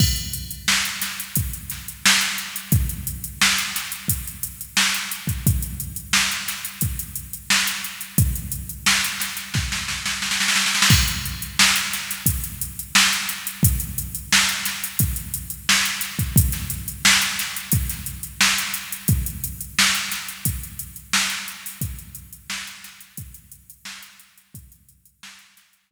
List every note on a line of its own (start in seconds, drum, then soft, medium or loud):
0.00 kick medium
0.00 crash medium
0.16 closed hi-hat soft
0.33 closed hi-hat medium
0.51 closed hi-hat medium
0.68 snare medium
0.85 closed hi-hat medium
1.02 snare soft
1.02 closed hi-hat medium
1.20 closed hi-hat medium
1.36 kick medium
1.36 closed hi-hat medium
1.53 closed hi-hat medium
1.70 snare soft
1.70 closed hi-hat medium
1.88 closed hi-hat medium
2.06 snare loud
2.21 closed hi-hat medium
2.38 closed hi-hat medium
2.56 closed hi-hat medium
2.72 kick medium
2.72 closed hi-hat medium
2.89 closed hi-hat medium
3.07 closed hi-hat medium
3.24 closed hi-hat medium
3.41 snare medium
3.58 closed hi-hat medium
3.76 snare soft
3.76 closed hi-hat medium
3.92 closed hi-hat medium
4.08 kick medium
4.08 closed hi-hat medium
4.27 closed hi-hat medium
4.43 closed hi-hat medium
4.61 closed hi-hat medium
4.77 snare medium
4.94 closed hi-hat medium
5.12 closed hi-hat medium
5.27 kick medium
5.27 closed hi-hat medium
5.47 kick medium
5.47 closed hi-hat medium
5.62 closed hi-hat medium
5.80 closed hi-hat medium
5.96 closed hi-hat medium
6.13 snare medium
6.32 closed hi-hat soft
6.48 snare soft
6.48 closed hi-hat medium
6.65 closed hi-hat medium
6.81 kick medium
6.81 closed hi-hat medium
6.99 closed hi-hat medium
7.15 closed hi-hat medium
7.33 closed hi-hat medium
7.50 snare medium
7.66 snare soft
7.66 closed hi-hat medium
7.84 closed hi-hat medium
8.01 closed hi-hat medium
8.18 kick medium
8.18 closed hi-hat medium
8.36 closed hi-hat medium
8.52 closed hi-hat medium
8.69 closed hi-hat medium
8.86 snare medium
9.04 closed hi-hat medium
9.20 snare medium
9.20 closed hi-hat medium
9.37 snare soft
9.37 closed hi-hat medium
9.54 kick medium
9.54 snare medium
9.72 snare medium
9.88 snare medium
10.06 snare medium
10.22 snare medium
10.31 snare medium
10.40 snare medium
10.48 snare medium
10.56 snare medium
10.66 snare medium
10.75 snare medium
10.82 snare medium
10.90 kick medium
10.90 crash medium
11.08 closed hi-hat medium
11.25 closed hi-hat medium
11.42 closed hi-hat medium
11.59 snare loud
11.76 closed hi-hat medium
11.93 snare soft
11.93 closed hi-hat medium
12.11 snare soft
12.11 closed hi-hat medium
12.26 kick medium
12.26 closed hi-hat loud
12.44 closed hi-hat medium
12.61 closed hi-hat medium
12.79 closed hi-hat medium
12.95 snare loud
13.13 closed hi-hat medium
13.29 closed hi-hat medium
13.47 closed hi-hat medium
13.63 kick medium
13.63 closed hi-hat loud
13.80 closed hi-hat medium
13.98 closed hi-hat medium
14.15 closed hi-hat medium
14.32 snare medium
14.49 closed hi-hat medium
14.65 snare soft
14.65 closed hi-hat medium
14.84 closed hi-hat medium
14.99 kick medium
14.99 closed hi-hat medium
15.16 closed hi-hat medium
15.34 closed hi-hat medium
15.50 closed hi-hat medium
15.69 snare medium
15.85 snare soft
15.85 closed hi-hat medium
16.01 snare soft
16.01 closed hi-hat medium
16.19 kick medium
16.19 closed hi-hat medium
16.36 kick loud
16.36 closed hi-hat loud
16.52 snare soft
16.52 closed hi-hat medium
16.70 closed hi-hat medium
16.88 closed hi-hat medium
17.05 snare loud
17.22 closed hi-hat medium
17.39 snare soft
17.39 closed hi-hat medium
17.56 closed hi-hat medium
17.72 kick medium
17.72 closed hi-hat medium
17.89 snare soft
17.89 closed hi-hat medium
18.06 closed hi-hat medium
18.23 closed hi-hat medium
18.41 snare medium
18.58 closed hi-hat medium
18.74 closed hi-hat medium
18.92 closed hi-hat medium
19.08 kick medium
19.08 closed hi-hat medium
19.26 closed hi-hat medium
19.44 closed hi-hat medium
19.61 closed hi-hat medium
19.79 snare loud
19.95 closed hi-hat medium
20.12 snare medium
20.12 closed hi-hat medium
20.29 closed hi-hat medium
20.45 kick medium
20.45 closed hi-hat medium
20.63 closed hi-hat medium
20.79 closed hi-hat medium
20.96 closed hi-hat medium
21.13 snare loud
21.30 closed hi-hat medium
21.48 closed hi-hat medium
21.66 open hi-hat medium
21.81 kick medium
21.81 closed hi-hat medium
21.99 closed hi-hat medium
22.15 closed hi-hat medium
22.33 closed hi-hat medium
22.50 snare medium
22.67 closed hi-hat soft
22.84 snare soft
22.84 closed hi-hat medium
23.01 closed hi-hat medium
23.17 kick medium
23.17 closed hi-hat medium
23.34 closed hi-hat medium
23.52 closed hi-hat medium
23.70 closed hi-hat medium
23.85 snare medium
24.02 closed hi-hat medium
24.19 closed hi-hat medium
24.37 closed hi-hat soft
24.54 kick medium
24.54 closed hi-hat medium
24.72 closed hi-hat medium
24.89 closed hi-hat medium
25.05 closed hi-hat medium
25.23 snare medium
25.39 closed hi-hat medium
25.57 snare soft
25.57 closed hi-hat medium
25.73 closed hi-hat medium
25.91 kick medium